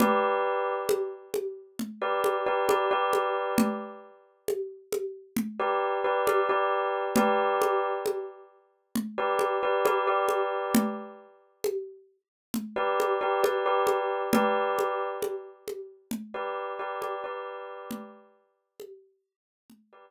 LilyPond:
<<
  \new Staff \with { instrumentName = "Tubular Bells" } { \time 4/4 \key g \lydian \tempo 4 = 67 <g' b' d''>2~ <g' b' d''>16 <g' b' d''>8 <g' b' d''>16 <g' b' d''>16 <g' b' d''>8.~ | <g' b' d''>2~ <g' b' d''>16 <g' b' d''>8 <g' b' d''>16 <g' b' d''>16 <g' b' d''>8. | <g' b' d''>2~ <g' b' d''>16 <g' b' d''>8 <g' b' d''>16 <g' b' d''>16 <g' b' d''>8.~ | <g' b' d''>2~ <g' b' d''>16 <g' b' d''>8 <g' b' d''>16 <g' b' d''>16 <g' b' d''>8. |
<g' b' d''>2~ <g' b' d''>16 <g' b' d''>8 <g' b' d''>16 <g' b' d''>16 <g' b' d''>8.~ | <g' b' d''>2~ <g' b' d''>16 <g' b' d''>8 r4 r16 | }
  \new DrumStaff \with { instrumentName = "Drums" } \drummode { \time 4/4 cgl4 cgho8 cgho8 cgl8 cgho8 cgho8 cgho8 | cgl4 cgho8 cgho8 cgl4 cgho4 | cgl8 cgho8 cgho4 cgl8 cgho8 cgho8 cgho8 | cgl4 cgho4 cgl8 cgho8 cgho8 cgho8 |
cgl8 cgho8 cgho8 cgho8 cgl4 cgho4 | cgl4 cgho4 cgl4 r4 | }
>>